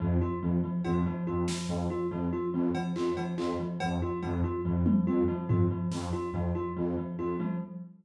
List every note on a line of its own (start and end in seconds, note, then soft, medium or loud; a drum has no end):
0.00 0.18 F2 medium
0.00 0.17 F3 medium
0.21 0.38 F4 medium
0.41 0.58 F2 medium
0.41 0.59 F3 medium
0.63 0.80 F3 medium
0.85 1.02 F2 medium
0.85 1.01 F4 medium
0.85 cowbell medium
1.06 1.23 F3 medium
1.27 1.44 F2 medium
1.27 1.44 F4 medium
1.48 1.65 F3 medium
1.48 snare medium
1.68 1.85 F2 medium
1.68 1.86 F3 medium
1.90 2.07 F4 medium
2.11 2.28 F2 medium
2.11 2.28 F3 medium
2.33 2.49 F4 medium
2.53 2.70 F2 medium
2.53 2.71 F3 medium
2.75 2.92 F3 medium
2.75 cowbell loud
2.96 3.13 F2 medium
2.96 3.13 F4 medium
2.96 clap medium
3.17 3.34 F3 medium
3.17 cowbell medium
3.38 3.55 F2 medium
3.38 3.55 F4 medium
3.38 clap medium
3.59 3.76 F3 medium
3.80 3.99 F2 medium
3.80 3.97 F3 medium
3.80 cowbell loud
4.02 4.19 F4 medium
4.22 4.40 F2 medium
4.22 4.39 F3 medium
4.22 cowbell medium
4.44 4.60 F4 medium
4.65 4.82 F2 medium
4.65 4.82 F3 medium
4.86 5.03 F3 medium
4.86 high tom loud
5.06 5.23 F2 medium
5.06 5.24 F4 medium
5.28 5.45 F3 medium
5.48 5.65 F2 medium
5.48 5.66 F4 medium
5.48 floor tom loud
5.71 5.87 F3 medium
5.91 6.09 F2 medium
5.91 6.08 F3 medium
5.91 snare medium
6.13 6.30 F4 medium
6.32 6.49 F2 medium
6.32 6.51 F3 medium
6.55 6.72 F4 medium
6.76 6.94 F2 medium
6.76 6.93 F3 medium
6.97 7.14 F3 medium
7.18 7.35 F2 medium
7.18 7.35 F4 medium
7.39 7.56 F3 medium
7.39 high tom medium